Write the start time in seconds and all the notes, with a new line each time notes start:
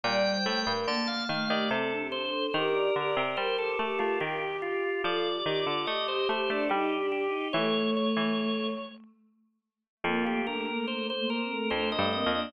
0.03 A#2 G3 D5 G5
0.32 C5
0.46 A2 A3
0.60 A#4
0.66 G2
0.87 D3 A#3 A5
1.07 A#3 F5
1.29 D#3 A3 F5
1.47 D#3 G4 D5
1.70 C3 C4 A4
1.91 D4
1.97 G4
2.12 D4 C5
2.27 A4
2.54 D#3 G4 A#4
2.72 D5
2.95 D3 G4 D5
3.16 C3
3.37 G3 G4 A#4 C5
3.58 G4 A4
3.79 A3 G4 A4
3.99 A3 F4
4.20 D#3 G4
4.41 G4
4.62 F4 G4
5.02 F3 F4 A4 D5
5.33 G4
5.45 D#3 G4
5.59 F4
5.66 D3
5.87 A3 G4 D#5
6.08 G4 C5
6.29 A3 G4 C5
6.48 A3 D4 A4
6.69 G3 D#4 G4
6.92 G4
6.98 D4
7.12 G4
7.26 D#4
7.53 E3 A3 C#5
7.97 C#5
8.16 E3
10.04 F2 A#3 F4
10.25 A3 G4
10.46 A3 D4 A#4
10.67 A3 A#3
10.86 A3 A#3 C5
11.08 A3 C5
11.15 A#3
11.30 A#4
11.43 C4
11.49 A3
11.70 F2 A3 D4 C5
11.92 A3 D#5
11.98 G2
12.11 A#3 C4 D#5
12.26 F2
12.32 A#3 D4